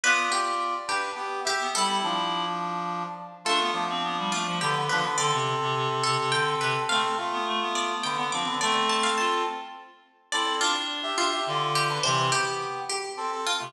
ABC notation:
X:1
M:3/4
L:1/16
Q:1/4=105
K:Ddor
V:1 name="Pizzicato Strings"
B2 G4 G2 z2 G2 | A8 z4 | A6 F2 G z B2 | d6 A2 g z B2 |
f6 d2 g z d'2 | d z a f a6 z2 | d2 F4 F2 z2 G2 | c2 G4 G2 z2 F2 |]
V:2 name="Brass Section"
[Fd]6 [DB]2 [B,G]2 [Ge]2 | [G,E]2 [F,D]8 z2 | [A,F]2 [F,D]6 [D,B,] [D,B,] [F,D] [D,B,] | [CA]12 |
[CA]2 [A,F]6 [D,B,] [D,B,] [F,D] [D,B,] | [CA]6 z6 | [CA]2 [Fd] z2 [Ge]2 [Ge] [Fd]3 [DB] | [E,C]2 [B,G]4 z2 [CA] [CA] z [A,F] |]
V:3 name="Clarinet"
B,2 z9 B, | E6 z6 | D B,2 C B, G, A, F, D,2 D, z | D, C,2 C, C, C, C, C, D,2 C, z |
A, z2 B, A, B,4 B, C2 | A,4 F2 z6 | E2 D4 D2 D,4 | C,2 z9 C, |]